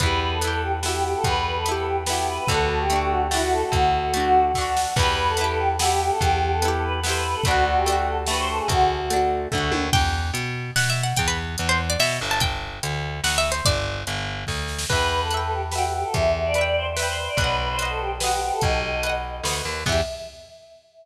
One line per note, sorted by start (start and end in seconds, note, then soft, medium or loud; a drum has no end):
0.00 1.15 E2 medium
0.00 0.38 B3 medium
0.00 0.38 E4 medium
0.00 0.20 B4 loud
0.00 kick loud
0.00 closed hi-hat loud
0.06 0.38 G4 medium
0.21 0.31 B4 medium
0.31 0.48 A4 medium
0.41 0.79 B3 medium
0.41 0.79 E4 medium
0.41 closed hi-hat loud
0.47 0.79 G4 medium
0.52 0.62 A4 loud
0.62 0.72 G4 medium
0.83 1.59 B3 medium
0.83 1.59 E4 medium
0.83 0.93 F#4 loud
0.83 snare loud
0.89 1.59 G4 medium
0.93 1.03 G4 medium
1.03 1.13 G4 medium
1.14 1.24 A4 medium
1.24 2.39 E2 medium
1.24 1.44 B4 loud
1.24 kick loud
1.24 closed hi-hat loud
1.45 1.55 B4 loud
1.55 1.73 A4 medium
1.66 2.04 B3 medium
1.66 2.04 E4 medium
1.66 closed hi-hat loud
1.71 2.04 G4 medium
1.76 1.86 A4 loud
1.86 1.96 G4 medium
2.06 2.45 B3 medium
2.06 2.45 E4 medium
2.06 2.17 F#4 medium
2.06 snare loud
2.13 2.45 G4 medium
2.17 2.27 G4 medium
2.28 2.37 B4 medium
2.38 2.48 B4 medium
2.47 3.63 D2 loud
2.47 2.86 A3 medium
2.47 2.86 D4 medium
2.47 2.68 A4 loud
2.47 kick loud
2.47 closed hi-hat loud
2.54 2.86 F#4 medium
2.69 2.79 A4 medium
2.79 2.99 G4 medium
2.90 3.28 A3 medium
2.90 3.28 D4 medium
2.90 closed hi-hat loud
2.96 3.28 F#4 medium
3.00 3.10 G4 loud
3.10 3.20 F#4 medium
3.31 4.07 A3 medium
3.31 4.07 D4 medium
3.31 3.41 E4 loud
3.31 snare loud
3.37 4.07 F#4 medium
3.41 3.51 F#4 loud
3.52 3.62 A4 loud
3.62 3.72 A4 medium
3.72 4.86 D2 medium
3.72 4.43 F#4 loud
3.72 kick loud
3.72 closed hi-hat loud
4.14 4.52 A3 medium
4.14 4.52 D4 medium
4.14 closed hi-hat loud
4.20 4.52 F#4 medium
4.54 4.93 A3 medium
4.54 4.93 D4 medium
4.54 kick medium
4.54 snare medium
4.61 4.93 F#4 medium
4.77 snare loud
4.96 6.10 E2 loud
4.96 5.35 B3 medium
4.96 5.35 E4 medium
4.96 5.15 B4 loud
4.96 kick loud
4.96 crash loud
5.02 5.35 G4 medium
5.17 5.27 B4 loud
5.28 5.45 A4 loud
5.37 5.76 B3 medium
5.37 closed hi-hat loud
5.41 5.76 E4 medium
5.41 5.76 G4 medium
5.48 5.58 A4 loud
5.59 5.68 G4 loud
5.79 6.55 B3 medium
5.79 6.55 E4 medium
5.79 5.89 F#4 loud
5.79 snare loud
5.85 6.55 G4 medium
5.90 5.99 G4 medium
6.00 6.10 G4 loud
6.10 6.20 A4 loud
6.21 7.35 E2 medium
6.21 6.39 G4 loud
6.21 kick loud
6.21 closed hi-hat loud
6.41 6.51 G4 medium
6.52 6.69 A4 medium
6.62 7.00 B3 medium
6.62 7.00 E4 medium
6.62 closed hi-hat loud
6.68 7.00 G4 medium
6.72 6.82 A4 medium
6.83 6.93 B4 loud
7.03 7.42 B3 medium
7.03 7.42 E4 medium
7.03 7.13 C5 loud
7.03 snare loud
7.09 7.42 G4 medium
7.14 7.24 B4 loud
7.24 7.34 B4 loud
7.34 7.44 A4 loud
7.44 8.60 D2 loud
7.44 7.83 A3 medium
7.44 7.63 F#4 loud
7.44 kick loud
7.44 closed hi-hat loud
7.48 7.83 D4 medium
7.48 7.83 F#4 medium
7.66 7.75 F#4 loud
7.76 7.94 G4 loud
7.86 8.24 A3 medium
7.86 8.24 D4 medium
7.86 closed hi-hat loud
7.92 8.24 F#4 medium
7.97 8.06 G4 medium
8.07 8.17 A4 medium
8.27 9.04 A3 medium
8.27 8.37 B4 loud
8.27 snare loud
8.31 9.04 D4 medium
8.31 9.04 F#4 medium
8.38 8.48 C5 loud
8.48 8.58 A4 loud
8.59 8.68 G#4 loud
8.68 9.47 D2 medium
8.68 9.07 F#4 loud
8.68 kick loud
8.68 closed hi-hat loud
9.10 9.48 A3 medium
9.10 9.48 D4 medium
9.10 closed hi-hat loud
9.16 9.48 F#4 medium
9.52 9.72 D2 medium
9.52 9.90 A3 medium
9.52 9.90 D4 medium
9.52 kick loud
9.52 floor tom medium
9.58 9.90 F#4 medium
9.72 9.90 D#2 medium
9.72 high tom loud
9.93 10.31 E2 loud
9.93 10.72 G5 loud
9.93 kick loud
9.93 crash loud
10.34 10.71 B2 medium
10.34 closed hi-hat loud
10.76 11.13 B2 medium
10.76 10.89 F#5 loud
10.76 snare loud
10.90 11.03 E5 medium
11.03 11.17 F#5 medium
11.16 11.56 E2 medium
11.16 11.27 G5 loud
11.16 kick loud
11.16 closed hi-hat loud
11.28 11.37 B4 medium
11.58 11.96 E2 medium
11.58 closed hi-hat loud
11.69 11.79 C5 loud
11.90 11.99 D5 loud
11.99 12.19 B2 medium
11.99 12.18 E5 loud
11.99 snare loud
12.21 12.79 G1 loud
12.31 12.41 A5 loud
12.40 13.17 G5 loud
12.40 kick loud
12.40 closed hi-hat loud
12.83 13.20 D2 medium
12.83 closed hi-hat loud
13.24 13.61 D2 medium
13.24 13.37 F#5 medium
13.24 snare loud
13.38 13.51 E5 loud
13.52 13.65 C5 medium
13.65 14.04 G1 medium
13.65 14.01 D5 loud
13.65 kick loud
13.65 closed hi-hat loud
14.07 14.45 G1 medium
14.07 closed hi-hat loud
14.47 14.85 D2 medium
14.47 kick medium
14.47 snare medium
14.68 snare medium
14.79 snare loud
14.89 16.04 E2 medium
14.89 15.07 B4 loud
14.89 15.28 B4 medium
14.89 15.28 E5 medium
14.89 kick loud
14.89 crash loud
14.96 15.28 G5 medium
15.10 15.20 B4 loud
15.21 15.39 A4 medium
15.31 15.69 B4 medium
15.31 15.69 E5 medium
15.31 closed hi-hat medium
15.37 15.69 G5 medium
15.41 15.51 A4 medium
15.52 15.62 G4 medium
15.72 15.82 F#4 medium
15.72 16.49 B4 medium
15.72 16.49 E5 medium
15.72 snare loud
15.78 16.49 G5 medium
15.83 15.93 G4 medium
15.93 16.03 G4 medium
16.03 16.13 A4 medium
16.14 17.28 E2 medium
16.14 16.31 E5 loud
16.14 kick loud
16.14 closed hi-hat loud
16.34 16.44 E5 medium
16.45 16.63 D5 loud
16.54 16.93 B4 medium
16.54 closed hi-hat loud
16.58 16.93 E5 medium
16.58 16.93 G5 medium
16.66 16.75 D5 medium
16.76 16.86 C5 medium
16.97 17.06 B4 medium
16.97 17.35 B4 medium
16.97 17.35 E5 medium
16.97 snare loud
17.02 17.35 G5 medium
17.07 17.17 C5 loud
17.17 17.27 C5 medium
17.28 17.37 D5 medium
17.37 18.51 B1 medium
17.37 17.56 B4 loud
17.37 17.76 B4 medium
17.37 17.76 D#5 medium
17.37 kick loud
17.37 closed hi-hat loud
17.44 17.76 F#5 medium
17.59 17.68 B4 medium
17.69 17.88 C5 loud
17.79 18.17 B4 medium
17.79 18.17 D#5 medium
17.79 closed hi-hat loud
17.85 18.17 F#5 medium
17.90 17.99 A4 loud
18.00 18.10 G4 loud
18.20 18.30 F#4 loud
18.20 18.97 B4 medium
18.20 18.97 D#5 medium
18.20 snare loud
18.27 18.97 F#5 medium
18.31 18.41 G4 medium
18.41 18.51 G4 loud
18.52 18.62 A4 loud
18.61 19.41 B1 medium
18.61 19.12 D#5 loud
18.61 kick loud
18.61 closed hi-hat loud
19.03 19.42 B4 medium
19.03 19.42 D#5 medium
19.03 closed hi-hat loud
19.09 19.42 F#5 medium
19.43 19.62 D2 medium
19.43 19.83 B4 medium
19.43 snare loud
19.48 19.83 D#5 medium
19.48 19.83 F#5 medium
19.65 19.84 D#2 medium
19.86 20.01 E2 loud
19.86 20.01 B3 medium
19.86 20.01 E4 medium
19.86 20.01 E5 loud
19.86 kick loud
19.86 crash loud
19.92 20.01 G4 medium